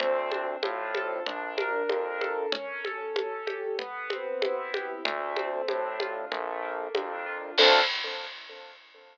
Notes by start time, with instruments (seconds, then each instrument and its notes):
0.00 synth bass 1 D2, acoustic grand piano C4, low conga
0.31 acoustic grand piano D4, high conga
0.63 synth bass 1 A2, acoustic grand piano F4, high conga
0.95 acoustic grand piano A4, high conga
1.26 synth bass 1 A#1, acoustic grand piano D4, low conga
1.58 acoustic grand piano A#4, high conga
1.89 synth bass 1 F2, acoustic grand piano D4, high conga
2.21 acoustic grand piano A4, high conga
2.52 acoustic grand piano C#4, low conga
2.85 acoustic grand piano A4, high conga
3.16 acoustic grand piano C#4, high conga
3.47 acoustic grand piano G4, high conga
3.79 acoustic grand piano B3, low conga
4.10 acoustic grand piano C4, high conga
4.42 acoustic grand piano E4, high conga
4.74 acoustic grand piano G4, high conga
5.05 synth bass 1 D2, acoustic grand piano A3, low conga
5.36 acoustic grand piano C4, high conga
5.68 synth bass 1 A2, acoustic grand piano D4, high conga
6.00 acoustic grand piano F4, high conga
6.31 synth bass 1 A#1, acoustic grand piano A3, low conga
6.62 acoustic grand piano A#3
6.95 synth bass 1 F2, acoustic grand piano D4, high conga
7.26 acoustic grand piano F4
7.58 synth bass 1 D2, acoustic grand piano C4 D4 F4 A4, kick, crash